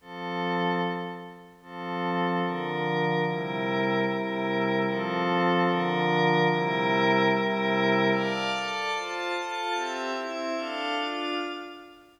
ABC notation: X:1
M:6/8
L:1/8
Q:3/8=148
K:F
V:1 name="Pad 5 (bowed)"
[F,CA]6 | z6 | [F,CA]6 | [D,F,B]6 |
[C,G,EB]6 | [C,G,EB]6 | [F,CA]6 | [D,F,B]6 |
[C,G,EB]6 | [C,G,EB]6 | [K:Dm] [dfa]3 [Ada]3 | [Fca]3 [FAa]3 |
[CGe]3 [CEe]3 | [DAf]3 [DFf]3 |]